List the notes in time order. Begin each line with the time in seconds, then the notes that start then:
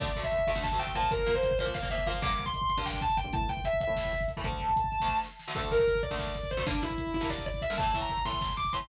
0.00 D2 D3 A3 D5, kick, closed hi-hat
0.08 kick
0.16 D2 D3 A3, kick, closed hi-hat
0.23 E5, kick
0.32 kick, closed hi-hat
0.39 kick
0.47 D2 D3 A3 E5, kick, closed hi-hat
0.55 D2 D3 A3, kick
0.63 A5, kick, snare
0.72 D2 D3 A3, kick
0.79 D2 D3 A3 G5, kick, closed hi-hat
0.87 kick
0.95 A#2 F3 A#3 A5, kick, closed hi-hat
1.03 kick
1.11 A#4, kick, closed hi-hat
1.19 kick
1.26 A#2 F3 A#3, kick, closed hi-hat
1.35 C5, kick
1.43 kick, closed hi-hat
1.51 kick
1.58 A#2 F3 A#3 C5, kick, closed hi-hat
1.66 A#2 F3 A#3, kick
1.74 F5, kick, snare
1.82 A#2 F3 A#3, kick
1.90 A#2 F3 A#3 E5, kick, closed hi-hat
1.98 kick
2.06 A#2 F3 A#3 F5, kick, closed hi-hat
2.14 kick
2.21 G2 D3 A#3 D6, kick, closed hi-hat
2.30 kick
2.37 kick, closed hi-hat
2.46 C6, kick
2.54 kick, closed hi-hat
2.62 kick
2.69 C6, kick, closed hi-hat
2.77 G2 D3 A#3, kick
2.86 G5, kick, snare
2.93 kick
3.01 A5, kick, closed hi-hat
3.10 kick
3.17 G5, kick, closed hi-hat
3.24 G2 D3 A#3, kick
3.33 A2 E3 A3 A5, kick, closed hi-hat
3.41 kick
3.49 G5, kick, closed hi-hat
3.57 kick
3.64 E5, kick, closed hi-hat
3.73 kick
3.81 E5, kick, closed hi-hat
3.87 A2 E3 A3, kick
3.96 kick, snare
4.04 kick
4.12 kick, closed hi-hat
4.21 kick
4.28 kick, closed hi-hat
4.37 A2 E3 A3, kick
4.44 D2 D3 A3 A5, kick, closed hi-hat
4.52 kick
4.59 kick, closed hi-hat
4.69 kick
4.76 kick, closed hi-hat
4.84 kick
4.92 kick, closed hi-hat
5.00 D2 D3 A3, kick
5.08 kick, snare
5.23 snare
5.39 snare
5.48 D2 D3 A3, snare
5.55 D2 D3 A3 A4, kick, crash
5.64 kick
5.71 A#4, kick, closed hi-hat
5.79 kick
5.87 kick, closed hi-hat
5.95 kick
6.03 D5, kick, closed hi-hat
6.11 D2 D3 A3, kick
6.19 kick, snare
6.27 kick
6.35 kick, closed hi-hat
6.43 kick
6.51 C5, kick, closed hi-hat
6.57 D2 D3 A3, kick
6.66 G2 D3 A#3 D4, kick, closed hi-hat
6.74 kick
6.82 E4, kick, closed hi-hat
6.90 kick
6.98 kick, closed hi-hat
7.07 kick
7.14 E4, kick, closed hi-hat
7.21 G2 D3 A#3, kick
7.30 D5, kick, snare
7.38 kick
7.46 D5, kick, closed hi-hat
7.54 kick
7.62 E5, kick, closed hi-hat
7.70 G2 D3 A#3
7.77 A2 E3 A3 A5, kick, closed hi-hat
7.86 kick
7.94 A2 E3 A3, kick, closed hi-hat
8.01 A#5, kick
8.09 kick, closed hi-hat
8.17 kick
8.25 A2 E3 A3 C6, kick, closed hi-hat
8.33 kick
8.41 kick, snare
8.49 kick
8.57 D6, kick, closed hi-hat
8.65 kick
8.73 A2 E3 A3 C6, kick, closed hi-hat
8.81 kick